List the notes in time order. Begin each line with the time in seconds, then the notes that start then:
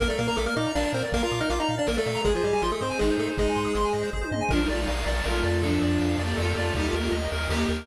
0.00 A#1 A#3 A#4 D5 F5, kick, closed hi-hat
0.08 A3 A4 D5, closed hi-hat
0.18 A#2 A#3 A#4 F5, closed hi-hat
0.28 A#3 A#4 A#5, closed hi-hat
0.36 A#1 A3 A4 D6, closed hi-hat
0.46 A#3 A#4 F6, closed hi-hat
0.56 A#2 D#4 D#5 D6, closed hi-hat
0.65 A#5, closed hi-hat
0.75 A#1 D4 A#4 D5 F5, snare
0.84 D5, closed hi-hat
0.93 A#2 C4 A#4 C5, closed hi-hat
1.02 D5, closed hi-hat
1.12 A#1 A#3 A#4 F5, kick, closed hi-hat
1.22 F4 F5 A#5, closed hi-hat
1.31 A#2 D6, closed hi-hat
1.41 D#4 D#5 F6, closed hi-hat
1.50 A#1 F4 F5 D6, closed hi-hat
1.59 D#4 D#5 A#5, closed hi-hat
1.69 A#2 F5
1.78 D4 D5
1.87 A#1 A#3 A#4, snare
1.97 A3 A4 D5, closed hi-hat
2.06 A#2 F5, closed hi-hat
2.15 A#5, closed hi-hat
2.25 G#1 G#3 G#4 C5 D#5, kick, closed hi-hat
2.35 F3 F4 C5, closed hi-hat
2.43 G#2 G3 G4 D#5, closed hi-hat
2.53 G3 G4 G#5, closed hi-hat
2.62 G#1 F3 F4 C6, closed hi-hat
2.71 A3 A4 D#6, closed hi-hat
2.80 G#2 C4 C5 C6, closed hi-hat
2.90 G#5, closed hi-hat
2.99 G#1 G#3 D#4 G#4 D#5, snare
3.10 C5, closed hi-hat
3.18 G#2 A3 G#4 A4, closed hi-hat
3.27 C5, closed hi-hat
3.37 G#1 G#3 D#4 G#4 D#5, kick, closed hi-hat
3.47 G#5, closed hi-hat
3.55 G#2 C6, closed hi-hat
3.65 D#6, closed hi-hat
3.75 G#1 C6, closed hi-hat
3.84 G#5, closed hi-hat
3.93 G#2 D#5, closed hi-hat
4.03 C5, closed hi-hat
4.13 G#1 G#4, kick
4.21 C5, high tom
4.31 G#2 D#5, mid tom
4.41 G#5
4.49 A#1 F3 D4 A#4 D5 F5, kick, crash
4.59 G3 D#4, ride
4.69 A#1 A3 F4 D5, ride
4.78 G3 D#4, ride
4.87 A#1 F5, ride
4.96 ride
5.06 A#1 D5, ride
5.17 ride
5.24 A#1 A3 F4 A#4, snare
5.34 ride
5.44 F2 D5, ride
5.53 ride
5.62 F3 D4 A4 D5 F5, kick, ride
5.73 ride
5.82 F2 D5, ride
5.92 ride
5.99 F2 F5, ride
6.09 ride
6.18 F2 A#3 G4 D5, ride
6.29 ride
6.37 F2 A3 F4 A4, snare
6.47 A#3 G4, ride
6.56 F2 A3 F4 D5, ride
6.66 ride
6.74 D#2 G3 D#4 G4 A#4 D#5, kick, ride
6.85 A3 F4, ride
6.93 D#2 A#3 G4 A#4, ride
7.02 A3 F4, ride
7.11 D#2 D#5, ride
7.23 ride
7.32 D#2 A#4, ride
7.40 ride
7.49 D#2 A#3 G4, snare
7.60 ride
7.68 D#2 A#4, ride
7.78 ride